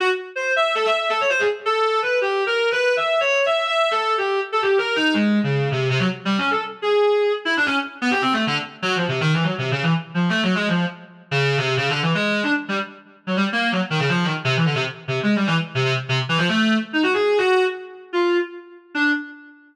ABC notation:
X:1
M:2/4
L:1/16
Q:1/4=163
K:none
V:1 name="Clarinet"
_G z3 c2 e2 | (3A2 e2 e2 A _d c _A | z2 A4 B2 | (3G4 _B4 =B4 |
(3e4 _d4 e4 | (3e4 A4 G4 | z A G2 _B2 _E2 | _A,3 _D,3 C,2 |
C, _G, z2 (3=G,2 _D2 A2 | z2 _A6 | z E D _D z3 B, | (3G2 C2 A,2 D, z3 |
(3_G,2 F,2 C,2 (3_E,2 =E,2 G,2 | (3C,2 _D,2 E,2 z2 F,2 | (3A,2 _G,2 _A,2 F,2 z2 | z3 _D,3 C,2 |
(3_D,2 =D,2 E,2 _A,3 D | z2 G, z5 | _G, =G, z _B,2 _G, z _E, | _D, F,2 _E, z C, =E, =D, |
C, z3 (3C,2 _A,2 G,2 | E, z2 C, C, z2 C, | z E, F, A,3 z2 | _E _G _A3 G3 |
z5 F3 | z6 D2 |]